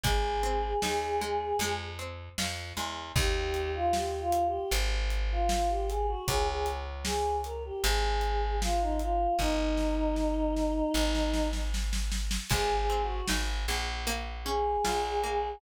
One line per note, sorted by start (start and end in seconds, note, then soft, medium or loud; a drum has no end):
0.04 0.74 G#1 medium
0.04 1.21 G#3 loud
0.04 1.71 G#4 medium
0.04 kick loud
0.04 closed hi-hat loud
0.43 1.54 C4 medium
0.82 1.53 D#2 medium
0.82 1.57 D#4 medium
0.82 snare loud
1.21 1.58 G#3 medium
1.59 2.29 F2 medium
1.59 2.76 G#3 loud
1.59 closed hi-hat loud
1.99 3.10 C4 medium
2.38 2.73 F2 medium
2.38 3.13 F4 medium
2.38 snare loud
2.77 3.12 E2 medium
2.77 3.14 G#3 medium
3.16 4.59 D#2 loud
3.16 3.69 G4 medium
3.16 kick loud
3.16 crash loud
3.54 closed hi-hat medium
3.74 3.93 F4 medium
3.93 4.19 G4 medium
3.93 snare loud
4.19 4.44 F4 medium
4.32 closed hi-hat loud
4.46 4.71 G4 medium
4.71 6.15 G#1 medium
4.71 closed hi-hat loud
5.10 closed hi-hat medium
5.31 5.49 F4 medium
5.49 5.69 F4 medium
5.49 snare loud
5.69 5.88 G4 medium
5.88 6.07 G#4 medium
5.88 closed hi-hat medium
6.07 6.26 F#4 medium
6.28 7.71 C#2 medium
6.28 6.47 G#4 medium
6.28 kick loud
6.28 closed hi-hat loud
6.47 6.66 G#4 medium
6.66 closed hi-hat medium
7.05 7.36 G#4 medium
7.05 snare loud
7.44 7.63 A#4 medium
7.44 closed hi-hat medium
7.65 7.83 G4 medium
7.84 9.27 G#1 loud
7.84 8.55 G#4 medium
7.84 closed hi-hat loud
8.21 closed hi-hat medium
8.61 8.80 F4 medium
8.61 snare loud
8.81 9.00 D#4 medium
9.00 9.34 F4 medium
9.00 closed hi-hat medium
9.39 10.82 G1 medium
9.39 11.47 D#4 medium
9.39 kick medium
9.39 snare medium
9.77 snare medium
10.16 snare medium
10.56 snare medium
10.94 12.38 G#1 loud
10.94 snare medium
11.15 snare medium
11.34 snare loud
11.53 snare medium
11.74 snare loud
11.93 snare loud
12.12 snare loud
12.31 snare loud
12.50 13.21 G#1 medium
12.50 13.68 G#3 loud
12.50 12.75 G#4 medium
12.50 kick loud
12.50 crash loud
12.78 13.02 G#4 medium
12.90 14.01 C4 medium
13.02 13.27 F#4 medium
13.28 13.66 G#1 medium
13.28 14.03 D#4 medium
13.28 snare loud
13.68 14.77 A#1 medium
13.68 14.05 G#3 medium
14.07 15.23 A#3 loud
14.07 closed hi-hat loud
14.45 15.57 C#4 medium
14.45 15.51 G#4 medium
14.85 15.55 A#1 medium
14.85 15.59 F4 medium
14.85 snare loud
15.24 15.61 A#3 medium